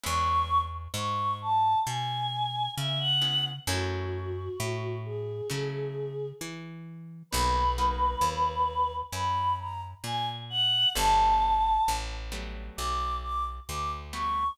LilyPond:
<<
  \new Staff \with { instrumentName = "Choir Aahs" } { \time 4/4 \key b \mixolydian \tempo 4 = 66 cis'''8. r16 cis'''8 a''8 gis''4 e''16 fis''8 r16 | fis'4. gis'4. r4 | b'2 b''8 ais''16 r16 gis''16 r16 fis''8 | a''4 r4 d'''8 d'''16 r16 d'''16 r16 cis'''8 | }
  \new Staff \with { instrumentName = "Acoustic Guitar (steel)" } { \time 4/4 \key b \mixolydian <gis b cis' e'>2.~ <gis b cis' e'>8 <gis b cis' e'>8 | <fis a cis' e'>2 <fis a cis' e'>2 | <fis ais b dis'>8 <fis ais b dis'>2.~ <fis ais b dis'>8 | <fis g a b>4. <fis g a b>2 <fis g a b>8 | }
  \new Staff \with { instrumentName = "Electric Bass (finger)" } { \clef bass \time 4/4 \key b \mixolydian e,4 gis,4 b,4 cis4 | fis,4 a,4 cis4 e4 | b,,4 dis,4 fis,4 ais,4 | g,,4 a,,4 b,,4 d,4 | }
>>